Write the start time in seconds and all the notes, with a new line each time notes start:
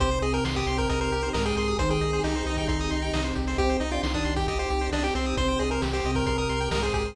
0.00 C2 C3 C4 D#4 G4 C5, kick, closed hi-hat
0.11 C5, closed hi-hat
0.22 C2 G#4 D#5, closed hi-hat
0.33 A#4 G5, closed hi-hat
0.45 C2 C6, snare
0.56 G4 D#6, kick, closed hi-hat
0.67 C2 C3 C4 C6, closed hi-hat
0.78 A#4 G5, kick, closed hi-hat
0.89 C2 A#4 D#5, kick, closed hi-hat
1.01 A#4 C5, closed hi-hat
1.11 C2 G4, closed hi-hat
1.23 C5, closed hi-hat
1.33 C2 G#2 G#3 A#4 D#5, snare
1.45 G#4 G5, closed hi-hat
1.57 C2 G#4 C6, closed hi-hat
1.68 D#6, closed hi-hat
1.78 C2 D#3 G3 C4 D#4 G4 C5 C6, kick, closed hi-hat
1.90 G#4 G5, closed hi-hat
2.01 C2 D#5, closed hi-hat
2.13 C5, closed hi-hat
2.23 C2 D#4 G4, snare
2.35 C5, closed hi-hat
2.46 C2 D#3 D#4 D#5, closed hi-hat
2.57 G5, kick, closed hi-hat
2.68 C2 D#4 C6, kick, closed hi-hat
2.79 D#6, closed hi-hat
2.91 C2 C6, closed hi-hat
3.02 G5, closed hi-hat
3.13 C2 C3 C4 D#5, snare
3.24 C5, closed hi-hat
3.35 C2 G4, kick, closed hi-hat
3.47 C5, open hi-hat
3.58 C2 C4 D#4 G4 C5, kick, closed hi-hat
3.69 C5, closed hi-hat
3.80 C2 D#4 D#5, closed hi-hat
3.91 D4 F4 D5 G5, closed hi-hat
4.03 C2 D#3 D#4 C6, snare
4.14 D4 D#6, kick, closed hi-hat
4.25 C2 C6, closed hi-hat
4.36 G4 G5, kick, closed hi-hat
4.47 C2 G4 D#5, kick, closed hi-hat
4.59 G4 C5, closed hi-hat
4.70 C2 G4, closed hi-hat
4.81 C5, closed hi-hat
4.92 C2 D4 D#5, snare
5.04 G4 G5, closed hi-hat
5.15 C2 C4 C6, closed hi-hat
5.26 D#6, closed hi-hat
5.37 C2 C3 G3 C4 G4 C5 C6, kick, closed hi-hat
5.48 G5, closed hi-hat
5.59 C2 G#4 D#5, closed hi-hat
5.71 A#4 C5, closed hi-hat
5.82 C2 G4, snare
5.93 G4 C5, closed hi-hat
6.04 C2 C3 C4 D#5, closed hi-hat
6.15 A#4 G5, kick, closed hi-hat
6.26 C2 A#4 C6, kick, closed hi-hat
6.38 A#4 D#6, closed hi-hat
6.49 C2 C6, closed hi-hat
6.60 G5, closed hi-hat
6.71 C2 G#2 G#3 A#4 D#5, snare
6.83 G#4 C5, closed hi-hat
6.94 C2 G4 G#4, kick, closed hi-hat
7.05 C5, closed hi-hat